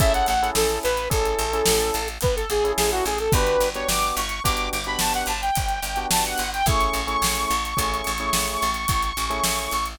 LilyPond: <<
  \new Staff \with { instrumentName = "Lead 2 (sawtooth)" } { \time 6/4 \key a \major \tempo 4 = 108 e''16 fis''16 fis''8 a'8 b'8 a'2 b'16 a'16 gis'8 gis'16 fis'16 gis'16 a'16 | b'8. cis''16 d'''8 cis'''8 d'''8 d'''16 b''16 a''16 fis''16 a''16 g''4~ g''16 a''16 fis''8 g''16 | cis'''1. | }
  \new Staff \with { instrumentName = "Electric Piano 1" } { \time 6/4 \key a \major <cis' e' gis' a'>8. <cis' e' gis' a'>4~ <cis' e' gis' a'>16 <cis' e' gis' a'>8. <cis' e' gis' a'>2 <cis' e' gis' a'>4~ <cis' e' gis' a'>16 | <b d' fis' g'>8. <b d' fis' g'>4~ <b d' fis' g'>16 <b d' fis' g'>8. <b d' fis' g'>2 <b d' fis' g'>4~ <b d' fis' g'>16 | <a cis' e' gis'>8. <a cis' e' gis'>4~ <a cis' e' gis'>16 <a cis' e' gis'>8. <a cis' e' gis'>2 <a cis' e' gis'>4~ <a cis' e' gis'>16 | }
  \new Staff \with { instrumentName = "Electric Bass (finger)" } { \clef bass \time 6/4 \key a \major a,,8 a,,8 a,,8 a,,8 a,,8 a,,8 a,,8 a,,8 a,,8 a,,8 a,,8 a,,8 | g,,8 g,,8 g,,8 g,,8 g,,8 g,,8 g,,8 g,,8 g,,8 g,,8 g,,8 g,,8 | a,,8 a,,8 a,,8 a,,8 a,,8 a,,8 a,,8 a,,8 a,,8 a,,8 a,,8 a,,8 | }
  \new DrumStaff \with { instrumentName = "Drums" } \drummode { \time 6/4 <hh bd>16 hh16 hh16 hh16 sn16 hh16 hh16 hh16 <hh bd>16 hh16 hh16 hh16 sn16 hh16 hh16 hh16 <hh bd>16 hh16 hh16 hh16 sn16 hh16 hh16 hh16 | <hh bd>16 hh16 hh16 hh16 sn16 hh16 hh16 hh16 <hh bd>16 hh16 hh16 hh16 sn16 hh16 hh16 hh16 <hh bd>16 hh16 hh16 hh16 sn16 hh16 hh16 hh16 | <hh bd>16 hh16 hh16 hh16 sn16 hh16 hh16 hh16 <hh bd>16 hh16 hh16 hh16 sn16 hh16 hh16 hh16 <hh bd>16 hh16 hh16 hh16 sn16 hh16 hh16 hh16 | }
>>